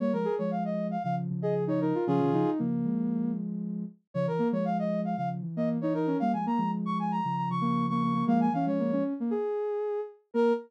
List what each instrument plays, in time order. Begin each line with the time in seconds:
0.00 ocarina G3 A#3, brass section C#5
0.13 ocarina F3 G#3, brass section A#4
0.25 ocarina G#4
0.38 ocarina F3 G#3, brass section C#5
0.51 brass section F5
0.65 brass section D#5
0.91 brass section F5
1.03 ocarina C#3 F3, brass section F5
1.30 ocarina C#3 F3
1.42 ocarina G#4, brass section D#5
1.67 ocarina D#4, brass section C#5
1.80 ocarina D#4, brass section A#4
1.95 ocarina F4
2.07 ocarina C#3 F3 C#4, brass section F4 G#4
2.20 ocarina C3 D#3
2.32 ocarina C#3 F3 D#4
2.59 ocarina C#3 F3 A#3
2.85 ocarina F3 G#3
4.14 ocarina C#3 F3, brass section C#5
4.27 ocarina E3, brass section A#4
4.39 ocarina A#3
4.52 ocarina F3 G#3, brass section C#5
4.65 brass section F5
4.79 brass section D#5
5.05 brass section F5
5.17 ocarina C#3 F3, brass section F5
5.42 ocarina E3
5.56 ocarina A#3, brass section D#5
5.81 ocarina D#4, brass section C#5
5.94 ocarina D#4, brass section A#4
6.07 ocarina C#4
6.20 ocarina G3 A#3, brass section F5
6.33 ocarina F3 G#3, brass section G#5
6.46 ocarina A#3, brass section A#5
6.58 ocarina F3 G#3
6.86 brass section C#6
6.99 brass section G#5
7.11 brass section A#5
7.25 ocarina C#3 F3
7.37 brass section A#5
7.50 ocarina C#3 F3, brass section C#6
7.61 ocarina A#3
7.89 ocarina A#3, brass section C#6
8.03 ocarina A#3
8.14 ocarina A#3
8.26 ocarina F3 G#3 A#3, brass section F5
8.40 brass section G#5
8.53 ocarina E3 C#4, brass section F5
8.66 ocarina F3 G#3, brass section C#5
8.79 ocarina A#3
8.92 ocarina C#4
9.20 ocarina A#3
9.31 ocarina G#4
10.34 ocarina A#3 A#4, brass section A#4